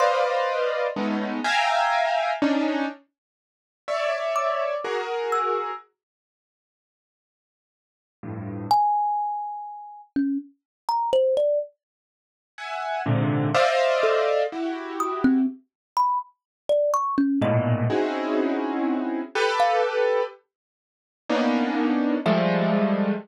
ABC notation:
X:1
M:6/8
L:1/16
Q:3/8=41
K:none
V:1 name="Acoustic Grand Piano"
[Bcd^df]4 [^G,A,B,^C^D]2 [ef=g^g^a]4 [C=D^D]2 | z4 [^cde]4 [^F^G^A]4 | z10 [F,,G,,A,,]2 | z12 |
z4 [e^f^g]2 [^G,,^A,,C,D,]2 [cd^de=f]4 | [E^FG]4 z8 | [^G,,A,,^A,,B,,]2 [C^C^DE^F^G]6 [=G=AB]4 | z4 [^A,B,^CD^D]4 [F,G,^G,=A,]4 |]
V:2 name="Kalimba"
c'6 z6 | z6 d'3 z e'2 | z12 | ^g6 ^C z2 ^a =c d |
z10 A2 | z2 ^d' C z2 b z2 =d ^c' ^C | ^d6 z3 f z2 | z8 e4 |]